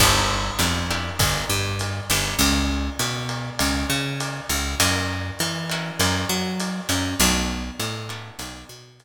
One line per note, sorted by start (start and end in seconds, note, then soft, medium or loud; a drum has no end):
0.00 0.51 G1 loud
0.00 0.42 B3 medium
0.00 0.42 D4 medium
0.00 0.42 E4 medium
0.00 0.42 G4 medium
0.00 kick medium
0.00 crash medium
0.00 ride medium
0.59 1.10 F2 medium
0.59 0.80 B3 medium
0.59 0.80 D4 medium
0.59 0.80 E4 medium
0.59 0.80 G4 medium
0.59 hi-hat pedal medium
0.59 ride medium
0.91 1.32 B3 medium
0.91 1.32 D4 medium
0.91 1.32 E4 medium
0.91 1.32 G4 medium
0.91 ride medium
1.19 1.45 G1 medium
1.19 kick medium
1.19 ride medium
1.50 2.00 G2 medium
1.79 hi-hat pedal medium
1.79 ride medium
2.10 2.35 G1 medium
2.10 2.83 B3 medium
2.10 2.83 C#4 medium
2.10 2.83 E4 medium
2.10 2.83 G4 medium
2.10 ride medium
2.39 2.90 C#2 medium
2.39 ride medium
2.99 3.50 B2 medium
2.99 hi-hat pedal medium
2.99 ride medium
3.29 ride medium
3.59 3.86 C#2 medium
3.59 ride medium
3.90 4.41 C#3 medium
4.20 hi-hat pedal medium
4.20 ride medium
4.49 4.75 C#2 medium
4.49 ride medium
4.80 5.31 F#2 medium
4.80 5.22 A#3 medium
4.80 5.22 C#4 medium
4.80 5.22 E4 medium
4.80 5.22 F#4 medium
4.80 ride medium
5.39 5.91 E3 medium
5.39 hi-hat pedal medium
5.39 ride medium
5.70 6.13 A#3 medium
5.70 6.13 C#4 medium
5.70 6.13 E4 medium
5.70 6.13 F#4 medium
5.70 ride medium
5.99 6.25 F#2 medium
5.99 ride medium
6.29 6.80 F#3 medium
6.60 hi-hat pedal medium
6.60 ride medium
6.89 7.15 F#2 medium
6.89 7.10 A#3 medium
6.89 7.10 C#4 medium
6.89 7.10 E4 medium
6.89 7.10 F#4 medium
6.89 ride medium
7.20 7.71 B1 loud
7.20 7.63 A3 medium
7.20 7.63 B3 medium
7.20 7.63 D4 loud
7.20 7.63 F#4 medium
7.20 ride medium
7.79 8.30 A2 medium
7.79 hi-hat pedal medium
7.79 ride medium
8.09 8.52 A3 medium
8.09 8.52 B3 medium
8.09 8.52 D4 medium
8.09 8.52 F#4 medium
8.09 ride medium
8.39 8.64 B1 medium
8.39 ride medium
8.69 9.05 B2 medium
9.00 hi-hat pedal medium
9.00 ride medium